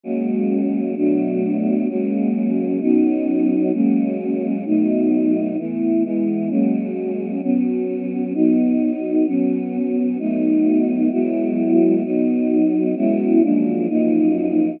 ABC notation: X:1
M:4/4
L:1/8
Q:1/4=130
K:F#mix
V:1 name="Choir Aahs"
[F,G,A,C]4 [B,,F,=A,=D]4 | [F,G,A,C]4 [F,B,CD]4 | [F,G,A,C]4 [B,,F,=A,D]4 | [E,=A,B,]2 [E,G,B,]2 [F,G,^A,C]4 |
[F,B,C]4 [F,B,D]4 | [F,B,C]4 [F,=A,B,D]4 | [F,G,B,E]4 [F,B,D]4 | [F,G,B,CE]2 [F,,^E,G,A,=D]2 [F,,E,A,^D]4 |]